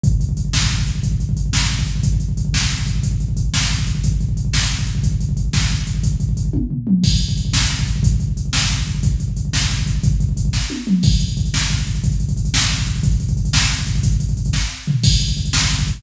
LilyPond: \new DrumStaff \drummode { \time 6/8 \tempo 4. = 120 <hh bd>16 bd16 <hh bd>16 bd16 <hh bd>16 bd16 <bd sn>16 bd16 <hh bd>16 bd16 <hh bd>16 bd16 | <hh bd>16 bd16 <hh bd>16 bd16 <hh bd>16 bd16 <bd sn>16 bd16 <hh bd>16 bd16 <hh bd>16 bd16 | <hh bd>16 bd16 <hh bd>16 bd16 <hh bd>16 bd16 <bd sn>16 bd16 <hh bd>16 bd16 <hh bd>16 bd16 | <hh bd>16 bd16 <hh bd>16 bd16 <hh bd>16 bd16 <bd sn>16 bd16 <hh bd>16 bd16 <hh bd>16 bd16 |
<hh bd>16 bd16 <hh bd>16 bd16 <hh bd>16 bd16 <bd sn>16 bd16 <hh bd>16 bd16 <hh bd>16 bd16 | <hh bd>16 bd16 <hh bd>16 bd16 <hh bd>16 bd16 <bd sn>16 bd16 <hh bd>16 bd16 <hh bd>16 bd16 | <hh bd>16 bd16 <hh bd>16 bd16 <hh bd>16 bd16 <bd tommh>8 tomfh8 toml8 | <cymc bd>16 bd16 <hh bd>16 bd16 <hh bd>16 bd16 <bd sn>16 bd16 <hh bd>16 bd16 <hh bd>16 bd16 |
<hh bd>16 bd16 <hh bd>16 bd16 <hh bd>16 bd16 <bd sn>16 bd16 <hh bd>16 bd16 <hh bd>16 bd16 | <hh bd>16 bd16 <hh bd>16 bd16 <hh bd>16 bd16 <bd sn>16 bd16 <hh bd>16 bd16 <hh bd>16 bd16 | <hh bd>16 bd16 <hh bd>16 bd16 <hh bd>16 bd16 <bd sn>8 tommh8 toml8 | <cymc bd>16 <hh bd>16 <hh bd>16 <hh bd>16 <hh bd>16 <hh bd>16 <bd sn>16 <hh bd>16 <hh bd>16 <hh bd>16 <hh bd>16 <hh bd>16 |
<hh bd>16 <hh bd>16 <hh bd>16 <hh bd>16 <hh bd>16 <hh bd>16 <bd sn>16 <hh bd>16 <hh bd>16 <hh bd>16 <hh bd>16 <hh bd>16 | <hh bd>16 <hh bd>16 <hh bd>16 <hh bd>16 <hh bd>16 <hh bd>16 <bd sn>16 <hh bd>16 <hh bd>16 <hh bd>16 <hh bd>16 <hh bd>16 | <hh bd>16 <hh bd>16 <hh bd>16 <hh bd>16 <hh bd>16 <hh bd>16 <bd sn>4 tomfh8 | <cymc bd>16 <hh bd>16 <hh bd>16 <hh bd>16 <hh bd>16 <hh bd>16 <bd sn>16 <hh bd>16 <hh bd>16 <hh bd>16 <hh bd>16 <hh bd>16 | }